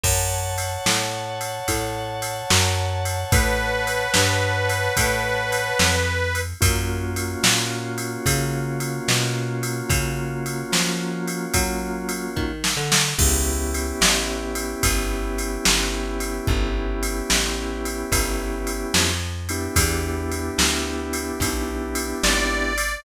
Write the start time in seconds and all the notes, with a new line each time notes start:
0.04 F#2 C#5 F#5 A5, kick, crash
0.58 ride
0.86 A2, snare
1.41 ride
1.68 A2, kick, ride
2.22 ride
2.50 F#2, snare
3.05 ride
3.32 A2 B4, kick, ride
3.87 ride
4.14 G2, snare
4.69 ride
4.97 A2, kick, ride
5.52 ride
5.79 F2, snare
6.35 ride
6.61 F#2 A#3 C#4 F4 F#4, kick, ride
7.16 ride
7.43 A#2, snare
7.98 ride
8.26 C#3, kick, ride
8.80 ride
9.08 B2, snare
9.63 ride
9.89 C#3, kick, ride
10.46 ride
10.72 F3, snare
11.28 ride
11.54 F#3, kick, ride
12.09 ride
12.36 D#3, kick
12.64 snare
12.77 D3
12.92 snare
13.18 C#2 B3 C#4 E4 G4, kick, crash
13.74 ride
14.01 A1, snare
14.55 ride
14.83 G1, kick, ride
15.38 ride
15.65 G1, snare
16.20 ride
16.47 G1, kick
17.03 ride
17.30 A1, snare
17.85 ride
18.12 G1, kick, ride
18.67 ride
18.94 F2, snare
19.49 B3 D4 E4 G4, ride
19.76 E2, kick, ride
20.32 ride
20.58 D2, snare
21.13 ride
21.40 B1, kick, ride
21.95 ride
22.23 G#1 D5, snare
22.78 ride